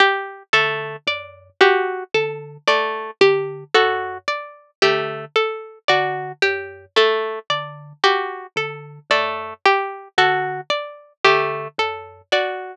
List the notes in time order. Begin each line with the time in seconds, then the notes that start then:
0.00 G4
0.53 D3 A3 A4
1.07 F#2 D5
1.61 F#4 G4
2.14 D3 A4
2.67 A3 D5
3.21 D3 G4
3.74 F#2 F#4 A4
4.28 D5
4.82 D3 A3 G4
5.36 A4
5.88 D3 F#4 D5
6.42 F#2 G4
6.96 A3 A4
7.50 D3 D5
8.04 F#4 G4
8.56 D3 A4
9.10 F#2 A3 D5
9.65 G4
10.18 D3 F#4 A4
10.70 D5
11.25 D3 A3 G4
11.78 F#2 A4
12.32 F#4 D5